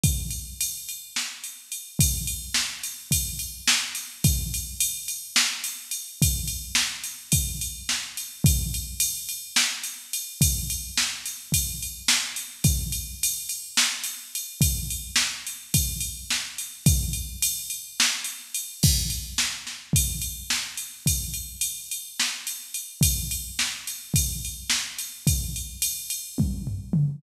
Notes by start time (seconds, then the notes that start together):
0.04 kick, ride
0.30 ride
0.61 ride
0.89 ride
1.16 snare
1.44 ride
1.72 ride
1.99 kick, ride
2.27 ride
2.54 snare
2.83 ride
3.11 kick, ride
3.39 ride
3.68 snare
3.95 ride
4.24 kick, ride
4.54 ride
4.80 ride
5.08 ride
5.36 snare
5.64 ride
5.91 ride
6.22 kick, ride
6.47 ride
6.75 snare
7.04 ride
7.32 kick, ride
7.61 ride
7.89 snare
8.17 ride
8.44 kick, ride
8.74 ride
9.00 ride
9.29 ride
9.56 snare
9.83 ride
10.13 ride
10.41 kick, ride
10.70 ride
10.97 snare
11.25 ride
11.52 kick, ride
11.82 ride
12.08 snare
12.36 ride
12.64 kick, ride
12.92 ride
13.23 ride
13.49 ride
13.77 snare
14.04 ride
14.35 ride
14.61 kick, ride
14.90 ride
15.16 snare
15.46 ride
15.74 kick, ride
16.00 ride
16.30 snare
16.58 ride
16.86 kick, ride
17.13 ride
17.42 ride
17.70 ride
18.00 snare
18.24 ride
18.54 ride
18.83 kick, crash
19.10 ride
19.38 snare
19.67 snare
19.93 kick, ride
20.21 ride
20.50 snare
20.77 ride
21.06 kick, ride
21.34 ride
21.61 ride
21.91 ride
22.20 snare
22.47 ride
22.74 ride
23.01 kick, ride
23.31 ride
23.59 snare
23.87 ride
24.14 kick, ride
24.45 ride
24.70 snare
24.98 ride
25.27 kick, ride
25.56 ride
25.82 ride
26.10 ride
26.38 kick, high tom
26.67 floor tom
26.93 mid tom